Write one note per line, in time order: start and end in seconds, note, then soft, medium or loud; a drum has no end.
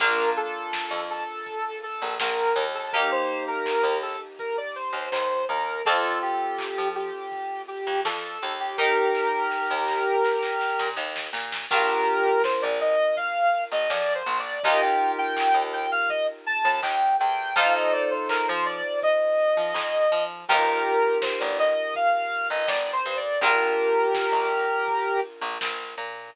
0.00 0.33 A#1 medium
0.00 2.86 A#3 medium
0.00 2.86 D4 medium
0.00 2.86 F4 medium
0.00 0.30 A#4 loud
0.00 kick loud
0.00 crash loud
0.37 1.00 A4 loud
0.37 open hi-hat medium
0.73 kick medium
0.73 snare loud
0.91 1.24 F2 medium
1.10 1.79 A4 loud
1.10 open hi-hat medium
1.46 kick medium
1.46 closed hi-hat loud
1.83 2.14 A4 loud
1.83 open hi-hat medium
2.02 2.18 A#1 medium
2.20 2.53 A#1 medium
2.20 2.65 A#4 medium
2.20 kick medium
2.20 snare loud
2.56 3.25 D#2 loud
2.56 open hi-hat medium
2.75 2.92 A4 medium
2.93 5.80 A#3 medium
2.93 5.80 D#4 medium
2.93 5.80 G4 loud
2.93 3.10 A#4 loud
2.93 kick loud
2.93 closed hi-hat loud
3.11 3.43 C5 loud
3.29 open hi-hat medium
3.47 3.98 A#4 medium
3.66 kick medium
3.66 clap loud
3.84 4.16 D#2 medium
4.02 4.20 A4 loud
4.02 open hi-hat medium
4.39 4.56 A#4 medium
4.39 kick medium
4.39 closed hi-hat loud
4.57 4.75 D5 medium
4.75 5.10 C5 medium
4.75 open hi-hat loud
4.93 5.09 D#2 medium
5.12 5.45 D#2 medium
5.12 5.44 C5 loud
5.12 kick loud
5.12 clap loud
5.49 5.82 D#2 medium
5.49 5.82 A#4 medium
5.49 open hi-hat medium
5.85 6.20 F2 loud
5.85 8.72 C4 loud
5.85 8.72 F4 medium
5.85 8.72 A4 medium
5.85 6.19 A4 loud
5.85 kick loud
5.85 closed hi-hat loud
6.22 6.88 G4 loud
6.22 open hi-hat medium
6.59 kick medium
6.59 clap loud
6.78 7.11 F3 medium
6.95 7.62 G4 medium
6.95 open hi-hat medium
7.32 kick medium
7.32 closed hi-hat loud
7.68 8.00 G4 loud
7.68 open hi-hat medium
7.87 8.03 F2 medium
8.05 8.38 F2 medium
8.05 8.53 A4 medium
8.05 kick medium
8.05 snare loud
8.41 9.12 D#2 medium
8.41 open hi-hat medium
8.60 8.77 G4 loud
8.78 11.65 D#4 medium
8.78 10.89 G4 medium
8.78 11.65 G4 medium
8.78 10.89 A#4 loud
8.78 11.65 A#4 loud
8.78 kick medium
8.78 snare medium
9.15 snare medium
9.51 snare medium
9.70 10.03 D#2 medium
9.88 snare medium
10.24 snare medium
10.43 snare medium
10.61 snare medium
10.79 10.96 A#2 medium
10.79 snare medium
10.96 11.29 D#2 medium
10.96 snare medium
11.16 snare loud
11.33 11.66 A#2 medium
11.33 snare loud
11.52 snare loud
11.71 12.04 A#1 loud
11.71 14.58 D4 medium
11.71 14.58 F4 medium
11.71 12.42 G4 loud
11.71 12.42 A#4 loud
11.71 14.58 A#4 medium
11.71 kick loud
11.71 crash loud
12.07 open hi-hat medium
12.44 12.61 C5 loud
12.44 kick loud
12.44 snare loud
12.62 12.96 A#1 medium
12.62 12.79 D5 loud
12.80 13.16 D#5 medium
12.80 open hi-hat medium
13.17 13.64 F5 loud
13.17 kick medium
13.17 closed hi-hat loud
13.54 open hi-hat medium
13.72 13.88 A#1 medium
13.72 13.89 D#5 loud
13.90 14.23 F2 medium
13.90 14.13 D5 loud
13.90 kick loud
13.90 snare loud
14.15 14.38 C5 loud
14.26 14.59 A#1 medium
14.26 open hi-hat medium
14.39 14.62 D5 loud
14.63 14.98 D#2 loud
14.63 17.51 D#4 medium
14.63 17.51 F4 loud
14.63 17.51 G4 loud
14.63 17.51 A#4 medium
14.63 14.81 D#5 loud
14.63 kick loud
14.63 closed hi-hat loud
14.82 15.11 G5 medium
15.00 open hi-hat loud
15.18 15.63 G5 loud
15.37 kick medium
15.37 clap loud
15.54 15.87 D#2 medium
15.73 15.90 G5 medium
15.73 open hi-hat medium
15.92 16.09 F5 loud
16.09 16.27 D#5 loud
16.09 kick loud
16.09 closed hi-hat loud
16.46 16.79 A5 loud
16.46 open hi-hat loud
16.65 16.81 D#2 medium
16.82 17.15 D#2 medium
16.82 17.16 G5 loud
16.82 kick medium
16.82 clap loud
17.20 17.54 E2 medium
17.20 17.55 G5 medium
17.20 open hi-hat medium
17.56 17.89 F2 loud
17.56 20.43 D#4 loud
17.56 20.43 F4 medium
17.56 20.43 A4 loud
17.56 20.43 C5 loud
17.56 17.73 F5 loud
17.56 kick loud
17.56 closed hi-hat loud
17.74 17.92 D#5 medium
17.92 18.10 D5 medium
17.92 open hi-hat medium
18.11 18.28 C5 medium
18.29 18.46 A#4 loud
18.29 kick medium
18.29 clap loud
18.48 18.82 F3 medium
18.48 18.65 C5 loud
18.66 19.00 D5 loud
18.66 open hi-hat medium
19.02 20.24 D#5 loud
19.02 kick loud
19.02 closed hi-hat loud
19.39 open hi-hat medium
19.57 19.73 F3 medium
19.74 20.07 F2 medium
19.74 kick loud
19.74 snare loud
20.12 20.45 F3 medium
20.12 open hi-hat medium
20.48 20.82 G1 loud
20.48 23.36 D#4 medium
20.48 23.36 F4 medium
20.48 21.18 G4 loud
20.48 23.36 G4 loud
20.48 21.18 A#4 loud
20.48 23.36 A#4 loud
20.48 kick loud
20.48 closed hi-hat loud
20.86 open hi-hat medium
21.22 21.39 C5 medium
21.22 kick medium
21.22 snare loud
21.40 21.74 G1 medium
21.40 21.58 D5 loud
21.59 21.94 D#5 medium
21.59 open hi-hat medium
21.95 22.47 F5 medium
21.95 kick medium
21.95 closed hi-hat loud
22.32 open hi-hat medium
22.50 22.67 G1 medium
22.50 22.68 D#5 medium
22.67 23.00 G1 medium
22.67 22.91 D5 medium
22.67 kick medium
22.67 snare loud
22.93 23.16 C5 loud
23.05 23.38 G2 medium
23.05 open hi-hat medium
23.17 23.40 D5 medium
23.41 23.74 A#1 loud
23.41 26.29 D4 medium
23.41 26.29 F4 medium
23.41 25.20 G4 loud
23.41 25.20 A#4 loud
23.41 26.29 A#4 loud
23.41 kick loud
23.41 closed hi-hat loud
23.78 open hi-hat loud
24.15 kick loud
24.15 snare loud
24.32 24.65 A#1 medium
24.51 open hi-hat loud
24.88 kick loud
24.88 closed hi-hat loud
25.24 open hi-hat medium
25.41 25.58 A#1 medium
25.61 25.95 A#1 medium
25.61 kick medium
25.61 snare loud
25.98 26.30 A#2 medium
25.98 open hi-hat medium